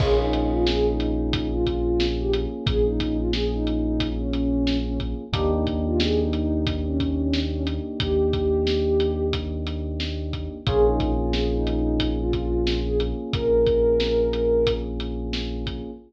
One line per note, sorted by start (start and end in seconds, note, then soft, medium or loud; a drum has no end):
0.00 2.47 A#1 medium
0.00 5.24 A#3 medium
0.00 5.24 C#4 medium
0.00 5.24 F4 medium
0.00 5.24 G#4 medium
0.00 0.19 G#4 loud
0.00 kick loud
0.00 crash loud
0.19 0.51 D#4 medium
0.33 closed hi-hat medium
0.52 0.65 F4 medium
0.67 0.85 G#4 medium
0.67 snare loud
0.86 1.47 D#4 medium
1.00 closed hi-hat medium
1.33 kick loud
1.33 closed hi-hat loud
1.53 2.04 F4 medium
1.66 kick medium
1.66 closed hi-hat medium
2.00 snare loud
2.19 2.33 G4 medium
2.33 closed hi-hat medium
2.66 5.14 A#1 medium
2.66 2.84 G#4 loud
2.66 kick loud
2.66 closed hi-hat loud
2.85 3.17 D#4 medium
3.00 kick medium
3.00 closed hi-hat medium
3.18 3.32 F4 medium
3.33 3.52 G#4 medium
3.33 snare loud
3.52 4.09 D#4 medium
3.67 closed hi-hat medium
4.00 kick medium
4.00 closed hi-hat loud
4.19 4.78 C#4 medium
4.33 closed hi-hat medium
4.67 snare loud
4.85 4.99 C#4 medium
5.00 kick medium
5.00 closed hi-hat medium
5.33 7.80 D#2 medium
5.33 10.57 A#3 medium
5.33 10.57 D4 medium
5.33 10.57 D#4 medium
5.33 5.51 G4 medium
5.33 10.57 G4 medium
5.33 kick loud
5.33 closed hi-hat loud
5.52 5.82 D#4 medium
5.67 kick medium
5.67 closed hi-hat medium
5.85 5.99 F4 medium
6.00 6.18 G#4 medium
6.00 snare loud
6.19 6.73 D#4 medium
6.33 closed hi-hat medium
6.67 kick loud
6.67 closed hi-hat loud
6.86 7.42 C#4 medium
7.00 kick medium
7.00 closed hi-hat medium
7.33 snare loud
7.52 7.65 C#4 medium
7.67 closed hi-hat medium
8.00 10.48 D#2 medium
8.00 9.25 G4 loud
8.00 kick loud
8.00 closed hi-hat loud
8.33 kick medium
8.33 closed hi-hat medium
8.67 snare loud
9.00 closed hi-hat medium
9.33 kick medium
9.33 closed hi-hat loud
9.67 closed hi-hat medium
10.00 snare loud
10.33 kick medium
10.33 closed hi-hat medium
10.67 13.14 A#1 medium
10.67 15.91 A#3 medium
10.67 15.91 C#4 medium
10.67 15.91 F4 medium
10.67 15.91 G#4 medium
10.67 10.85 G#4 loud
10.67 kick loud
10.67 closed hi-hat loud
10.86 11.12 D#4 medium
11.00 kick loud
11.00 closed hi-hat medium
11.19 11.33 F4 medium
11.33 11.51 G#4 medium
11.33 snare loud
11.53 12.09 D#4 medium
11.67 closed hi-hat medium
12.00 kick medium
12.00 closed hi-hat loud
12.19 12.79 F4 medium
12.33 kick medium
12.33 closed hi-hat medium
12.67 snare loud
12.86 12.99 G#4 medium
13.00 closed hi-hat medium
13.33 15.81 A#1 medium
13.33 14.72 A#4 loud
13.33 kick loud
13.33 closed hi-hat loud
13.67 kick medium
13.67 closed hi-hat medium
14.00 snare loud
14.33 closed hi-hat medium
14.67 kick medium
14.67 closed hi-hat loud
15.00 closed hi-hat medium
15.33 snare loud
15.67 kick medium
15.67 closed hi-hat medium